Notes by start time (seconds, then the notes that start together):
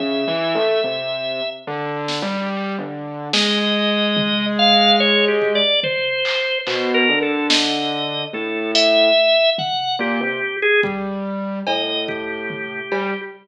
0.00 C#3 E5, floor tom
0.28 E3
0.55 A3
0.84 C3
1.67 D3
2.08 snare
2.22 G3
2.78 D3
3.33 G#3 D#5, snare
4.17 floor tom
4.59 F5
5.00 C#5
5.28 G4
5.42 kick
5.55 D5
5.83 C5, floor tom
6.25 clap
6.67 B2 C5, clap
6.94 A#4
7.09 D3
7.22 A4
7.50 D#5, snare
8.33 A2 A4
8.75 E5, closed hi-hat
9.58 F#5, floor tom
9.99 A#2 G4
10.21 C3
10.62 G#4
10.83 G3, kick
11.67 A2 D#5, cowbell
12.08 G4, kick
12.50 floor tom
12.92 G3, cowbell